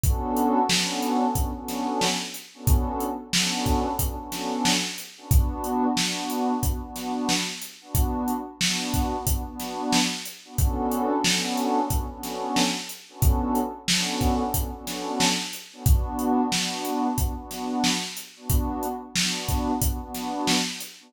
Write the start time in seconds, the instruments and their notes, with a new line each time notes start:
0.04 pad 2 (warm) B3 C#4 D4 F#4 A4, kick, closed hi-hat
0.37 closed hi-hat
0.69 pad 2 (warm) B3 C#4 D4 F#4 A4, snare
1.02 closed hi-hat
1.35 pad 2 (warm) B3 C#4 D4 F#4 A4, kick, closed hi-hat
1.55 pad 2 (warm) B3 C#4 D4 F#4 A4
1.68 snare, closed hi-hat
2.01 snare
2.34 closed hi-hat
2.54 pad 2 (warm) B3 C#4 D4 F#4 A4
2.67 kick, closed hi-hat
3.00 closed hi-hat
3.33 pad 2 (warm) B3 C#4 D4 F#4 A4, snare
3.66 kick, closed hi-hat
3.99 pad 2 (warm) B3 C#4 D4 F#4 A4, kick, closed hi-hat
4.18 pad 2 (warm) B3 C#4 D4 F#4 A4
4.32 snare, closed hi-hat
4.65 snare
4.98 closed hi-hat
5.17 pad 2 (warm) B3 C#4 D4 F#4 A4
5.31 pad 2 (warm) B3 D4 F#4, kick, closed hi-hat
5.64 closed hi-hat
5.97 pad 2 (warm) B3 D4 F#4, snare
6.30 closed hi-hat
6.63 pad 2 (warm) B3 D4 F#4, kick, closed hi-hat
6.82 pad 2 (warm) B3 D4 F#4
6.96 snare, closed hi-hat
7.29 snare
7.62 closed hi-hat
7.81 pad 2 (warm) B3 D4 F#4
7.95 kick, closed hi-hat
8.28 closed hi-hat
8.60 pad 2 (warm) B3 D4 F#4, snare
8.94 kick, closed hi-hat
9.27 pad 2 (warm) B3 D4 F#4, kick, closed hi-hat
9.46 pad 2 (warm) B3 D4 F#4
9.60 snare, closed hi-hat
9.93 snare
10.26 closed hi-hat
10.45 pad 2 (warm) B3 D4 F#4
10.58 pad 2 (warm) B3 C#4 D4 F#4 A4, kick, closed hi-hat
10.91 closed hi-hat
11.24 pad 2 (warm) B3 C#4 D4 F#4 A4, snare
11.57 closed hi-hat
11.90 pad 2 (warm) B3 C#4 D4 F#4 A4, kick, closed hi-hat
12.10 pad 2 (warm) B3 C#4 D4 F#4 A4
12.23 snare, closed hi-hat
12.56 snare
12.89 closed hi-hat
13.09 pad 2 (warm) B3 C#4 D4 F#4 A4
13.22 kick, closed hi-hat
13.55 closed hi-hat
13.88 pad 2 (warm) B3 C#4 D4 F#4 A4, snare
14.21 kick, closed hi-hat
14.54 pad 2 (warm) B3 C#4 D4 F#4 A4, kick, closed hi-hat
14.73 pad 2 (warm) B3 C#4 D4 F#4 A4
14.87 snare, closed hi-hat
15.20 snare
15.53 closed hi-hat
15.72 pad 2 (warm) B3 C#4 D4 F#4 A4
15.86 pad 2 (warm) B3 D4 F#4, kick, closed hi-hat
16.19 closed hi-hat
16.52 pad 2 (warm) B3 D4 F#4, snare
16.85 closed hi-hat
17.18 pad 2 (warm) B3 D4 F#4, kick, closed hi-hat
17.37 pad 2 (warm) B3 D4 F#4
17.51 snare, closed hi-hat
17.84 snare
18.17 closed hi-hat
18.36 pad 2 (warm) B3 D4 F#4
18.50 kick, closed hi-hat
18.83 closed hi-hat
19.16 pad 2 (warm) B3 D4 F#4, snare
19.49 kick, closed hi-hat
19.82 pad 2 (warm) B3 D4 F#4, kick, closed hi-hat
20.01 pad 2 (warm) B3 D4 F#4
20.15 snare, closed hi-hat
20.47 snare
20.80 closed hi-hat
21.00 pad 2 (warm) B3 D4 F#4